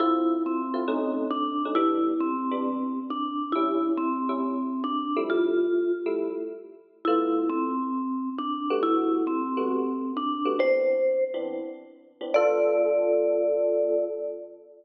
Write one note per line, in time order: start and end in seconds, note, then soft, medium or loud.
0.00 0.35 D3 medium
0.00 0.35 C4 medium
0.00 0.35 E4 medium
0.00 0.42 E4 medium
0.00 0.35 F4 medium
0.46 1.27 C4 medium
0.74 0.83 D3 medium
0.74 0.83 C4 medium
0.74 0.83 E4 medium
0.74 0.83 F4 medium
0.88 1.23 B2 medium
0.88 1.23 A3 medium
0.88 1.23 C#4 medium
0.88 1.23 D#4 medium
1.31 1.72 D4 medium
1.65 1.75 B2 medium
1.65 1.75 A3 medium
1.65 1.75 C#4 medium
1.65 1.75 D#4 medium
1.75 2.11 E3 medium
1.75 2.11 G3 medium
1.75 2.11 B3 medium
1.75 2.11 D4 medium
1.75 2.14 E4 medium
2.20 2.99 C4 medium
2.51 2.77 E3 medium
2.51 2.77 G3 medium
2.51 2.77 B3 medium
2.51 2.77 D4 medium
3.10 3.52 D4 medium
3.52 3.91 A2 medium
3.52 3.91 G3 medium
3.52 3.91 C#4 medium
3.52 3.92 E4 medium
3.52 3.91 E4 medium
3.97 4.84 C4 medium
4.29 4.55 A2 medium
4.29 4.55 G3 medium
4.29 4.55 C#4 medium
4.29 4.55 E4 medium
4.84 5.23 D4 medium
5.16 5.66 F3 medium
5.16 5.66 G3 medium
5.16 5.66 A3 medium
5.16 5.66 E4 medium
5.30 5.92 F4 medium
6.06 6.32 F3 medium
6.06 6.32 G3 medium
6.06 6.32 A3 medium
6.06 6.32 E4 medium
7.05 7.43 D3 medium
7.05 7.43 A3 medium
7.05 7.43 B3 medium
7.05 7.48 E4 medium
7.05 7.43 F4 medium
7.49 8.29 C4 medium
8.38 8.79 D4 medium
8.70 9.20 G3 medium
8.70 9.20 A3 medium
8.70 9.20 B3 medium
8.70 9.20 F#4 medium
8.83 9.24 E4 medium
9.27 10.12 C4 medium
9.57 9.83 G3 medium
9.57 9.83 A3 medium
9.57 9.83 B3 medium
9.57 9.83 F#4 medium
10.17 10.59 D4 medium
10.45 10.55 G3 medium
10.45 10.55 A3 medium
10.45 10.55 B3 medium
10.45 10.55 F#4 medium
10.59 10.95 E3 medium
10.59 10.95 B3 medium
10.59 10.95 C4 medium
10.59 10.95 D4 medium
10.59 11.24 C5 medium
11.34 11.60 E3 medium
11.34 11.60 B3 medium
11.34 11.60 C4 medium
11.34 11.60 D4 medium
12.21 12.30 E3 medium
12.21 12.30 B3 medium
12.21 12.30 C4 medium
12.21 12.30 D4 medium
12.34 14.06 D3 loud
12.34 14.06 B3 medium
12.34 14.06 F4 loud
12.34 14.06 A4 loud
12.34 14.04 D5 loud